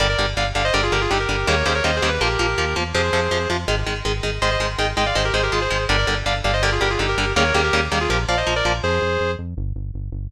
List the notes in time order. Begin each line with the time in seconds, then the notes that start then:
0.00 G1 D3 G3 A#4 D5
0.09 A#4 D5
0.18 G1 D3 G3
0.37 G1 D3 G3 D5 F5
0.55 G1 D3 G3 D5 F5
0.64 C5 D#5
0.74 G1 D3 G3 A#4 D5
0.83 F4 G#4
0.92 G1 D3 G3 G4 A#4
1.01 F4 G#4
1.10 G1 D3 G3 D#4 G4
1.20 G4 A#4
1.29 G1 D3 G3
1.47 D#2 C#3 D#3 G3 A#3 A#4 C#5
1.66 D#2 C#3 D#3 G3 A#3 G#4 C5
1.75 A#4 C#5
1.84 D#2 C#3 D#3 G3 A#3 C5 D#5
1.96 G#4 C5
2.02 D#2 C#3 D#3 G3 A#3
2.09 B4
2.21 A#1 F3 A#3 G4 A#4
2.39 A#1 F3 A#3
2.58 D#2 F3 A#3
2.76 E2 F3 A#3
2.94 F2 C3 F3 G#4 C5
3.13 F2 C3 F3
3.31 F2 C3 F3
3.50 F2 C3 F3
3.68 G#1 D#3 G#3
3.87 G#1 D#3 G#3
4.05 G#1 D#3 G#3
4.23 G#1 D#3 G#3
4.42 G#1 D#3 G#3 C5 D#5
4.51 C5 D#5
4.60 G#1 D#3 G#3
4.78 G#1 D#3 G#3 D#5 G5
4.97 G#1 D#3 G#3 D#5 G5
5.06 D5 F5
5.15 G#1 D#3 G#3 C5 D#5
5.25 G4 A#4
5.34 G#1 D#3 G#3 G#4 C5
5.43 G4 A#4
5.52 G#1 D#3 G#3 F4 G#4
5.61 G#4 C5
5.70 G#1 D#3 G#3
5.89 G1 D3 G3 A#4 D5
5.98 A#4 D5
6.07 G1 D3 G3
6.26 G1 D3 G3 D5 F5
6.44 G1 D3 G3 D5 F5
6.53 C5 D#5
6.62 D3 G3 A#4 D5
6.72 F4 G#4
6.81 G1 D3 G3 G4 A#4
6.90 F4 G#4
6.99 G1 D3 G3 D#4 G4
7.09 G4 A#4
7.18 G1 D3 G3
7.36 D#2 C#3 D#3 G3 A#3 A#4 C#5
7.54 D#2 C#3 D#3 G3 A#3 G4 A#4
7.64 G4 A#4
7.73 D#2 C#3 D#3 G3 A#3
7.92 D#2 C#3 D#3 G3 A#3
8.01 F4 G#4
8.10 A#1 F3 A#3 G4 A#4
8.28 A#1 F3 A#3 D5 F5
8.37 C5 D#5
8.47 A#1 F3 A#3
8.56 A#4 D5
8.65 A#1 F3 A#3
8.83 F2 G#4 C5
9.02 F2
9.20 F2
9.39 F2
9.57 G1
9.76 G1
9.94 G1
10.12 G1